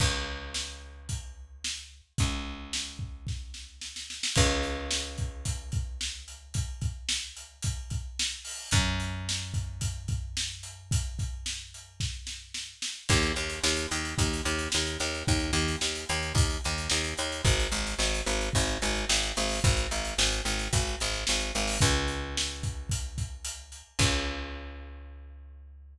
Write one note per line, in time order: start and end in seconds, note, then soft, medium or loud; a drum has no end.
0.00 2.01 C#2 medium
0.00 kick loud
0.00 crash loud
0.54 snare loud
1.09 kick medium
1.09 closed hi-hat medium
1.64 snare loud
2.18 4.21 C#2 medium
2.18 kick loud
2.18 closed hi-hat loud
2.73 snare loud
2.99 kick medium
3.27 kick medium
3.27 snare medium
3.54 snare medium
3.81 snare medium
3.96 snare medium
4.10 snare medium
4.23 snare loud
4.36 8.39 C#2 loud
4.36 kick loud
4.36 crash loud
4.63 closed hi-hat medium
4.91 snare loud
5.18 kick medium
5.18 closed hi-hat medium
5.45 kick medium
5.45 closed hi-hat loud
5.72 kick medium
5.72 closed hi-hat medium
6.01 snare loud
6.28 closed hi-hat medium
6.54 kick medium
6.54 closed hi-hat loud
6.81 kick medium
6.81 closed hi-hat medium
7.09 snare loud
7.36 closed hi-hat medium
7.63 kick medium
7.63 closed hi-hat loud
7.90 kick medium
7.90 closed hi-hat medium
8.19 snare loud
8.45 open hi-hat medium
8.71 12.74 F#2 loud
8.71 kick loud
8.71 closed hi-hat loud
9.00 closed hi-hat medium
9.29 snare loud
9.54 kick medium
9.54 closed hi-hat medium
9.81 kick medium
9.81 closed hi-hat loud
10.08 kick medium
10.08 closed hi-hat medium
10.37 snare loud
10.63 closed hi-hat medium
10.91 kick loud
10.91 closed hi-hat loud
11.19 kick medium
11.19 closed hi-hat medium
11.46 snare loud
11.74 closed hi-hat medium
12.00 kick medium
12.00 snare medium
12.27 snare medium
12.54 snare medium
12.82 snare loud
13.09 13.33 D#2 loud
13.09 kick loud
13.09 crash loud
13.22 closed hi-hat medium
13.36 13.59 D#2 medium
13.36 closed hi-hat medium
13.49 closed hi-hat medium
13.64 13.87 D#2 medium
13.64 snare loud
13.77 closed hi-hat medium
13.91 14.15 D#2 medium
13.91 closed hi-hat medium
14.05 closed hi-hat medium
14.18 14.42 D#2 medium
14.18 kick loud
14.18 closed hi-hat loud
14.33 closed hi-hat medium
14.45 14.69 D#2 medium
14.45 closed hi-hat medium
14.59 closed hi-hat medium
14.72 14.98 D#2 medium
14.72 snare loud
14.86 closed hi-hat medium
15.00 15.23 D#2 medium
15.00 closed hi-hat medium
15.14 closed hi-hat medium
15.27 15.51 D#2 medium
15.27 kick loud
15.27 closed hi-hat loud
15.39 closed hi-hat medium
15.53 15.76 D#2 medium
15.53 closed hi-hat medium
15.68 closed hi-hat medium
15.81 16.05 D#2 medium
15.81 snare loud
15.95 closed hi-hat medium
16.09 16.33 D#2 medium
16.09 closed hi-hat medium
16.22 closed hi-hat medium
16.35 16.58 D#2 medium
16.35 kick loud
16.35 closed hi-hat loud
16.50 closed hi-hat medium
16.64 16.88 D#2 medium
16.64 closed hi-hat medium
16.78 closed hi-hat medium
16.90 17.14 D#2 medium
16.90 snare loud
17.04 closed hi-hat medium
17.17 17.42 D#2 medium
17.17 closed hi-hat medium
17.32 closed hi-hat medium
17.45 17.68 G#1 medium
17.45 kick loud
17.45 closed hi-hat loud
17.60 closed hi-hat medium
17.72 17.95 G#1 medium
17.72 closed hi-hat medium
17.87 closed hi-hat medium
17.99 18.22 G#1 medium
17.99 snare loud
18.14 closed hi-hat medium
18.26 18.50 G#1 medium
18.26 closed hi-hat medium
18.41 closed hi-hat medium
18.53 18.78 G#1 medium
18.53 kick loud
18.53 closed hi-hat loud
18.67 closed hi-hat medium
18.82 19.05 G#1 medium
18.82 closed hi-hat medium
18.95 closed hi-hat medium
19.09 19.33 G#1 medium
19.09 snare loud
19.23 closed hi-hat medium
19.36 19.60 G#1 medium
19.36 closed hi-hat medium
19.49 open hi-hat medium
19.64 19.87 G#1 medium
19.64 kick loud
19.64 closed hi-hat loud
19.77 closed hi-hat medium
19.91 20.14 G#1 medium
19.91 closed hi-hat medium
20.05 closed hi-hat medium
20.18 20.41 G#1 medium
20.18 snare loud
20.32 closed hi-hat medium
20.45 20.68 G#1 medium
20.45 closed hi-hat medium
20.59 closed hi-hat medium
20.73 20.96 G#1 medium
20.73 kick loud
20.73 closed hi-hat loud
20.87 closed hi-hat medium
21.00 21.24 G#1 medium
21.00 closed hi-hat medium
21.14 closed hi-hat medium
21.27 21.52 G#1 medium
21.27 snare loud
21.40 closed hi-hat medium
21.55 21.78 G#1 medium
21.55 closed hi-hat medium
21.68 open hi-hat medium
21.81 23.82 C#2 loud
21.81 kick loud
21.81 closed hi-hat loud
22.08 closed hi-hat medium
22.37 snare loud
22.63 kick medium
22.63 closed hi-hat medium
22.89 kick medium
22.89 closed hi-hat loud
23.18 kick medium
23.18 closed hi-hat medium
23.45 closed hi-hat loud
23.72 closed hi-hat medium
23.99 25.98 C#2 loud
23.99 kick loud
23.99 crash loud